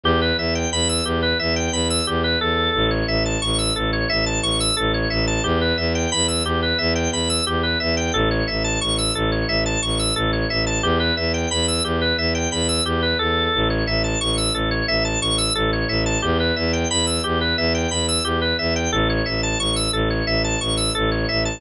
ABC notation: X:1
M:4/4
L:1/16
Q:1/4=89
K:Edor
V:1 name="Drawbar Organ"
G B e g b e' G B e g b e' G B A2- | A c e a c' e' A c e a c' e' A c e a | G B e g b e' G B e g b e' G B e g | A c e a c' e' A c e a c' e' A c e a |
G B e g b e' G B e g b e' G B A2- | A c e a c' e' A c e a c' e' A c e a | G B e g b e' G B e g b e' G B e g | A c e a c' e' A c e a c' e' A c e a |]
V:2 name="Violin" clef=bass
E,,2 E,,2 E,,2 E,,2 E,,2 E,,2 E,,2 E,,2 | A,,,2 A,,,2 A,,,2 A,,,2 A,,,2 A,,,2 A,,,2 A,,,2 | E,,2 E,,2 E,,2 E,,2 E,,2 E,,2 E,,2 E,,2 | A,,,2 A,,,2 A,,,2 A,,,2 A,,,2 A,,,2 A,,,2 A,,,2 |
E,,2 E,,2 E,,2 E,,2 E,,2 E,,2 E,,2 E,,2 | A,,,2 A,,,2 A,,,2 A,,,2 A,,,2 A,,,2 A,,,2 A,,,2 | E,,2 E,,2 E,,2 E,,2 E,,2 E,,2 E,,2 E,,2 | A,,,2 A,,,2 A,,,2 A,,,2 A,,,2 A,,,2 A,,,2 A,,,2 |]